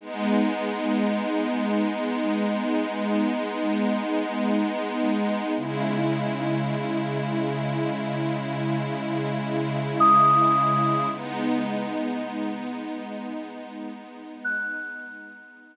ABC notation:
X:1
M:5/4
L:1/8
Q:"Swing 16ths" 1/4=54
K:G#phr
V:1 name="Electric Piano 2"
z10 | z8 d'2 | z6 f'4 |]
V:2 name="Pad 5 (bowed)"
[G,B,D]10 | [C,G,E]10 | [G,B,D]10 |]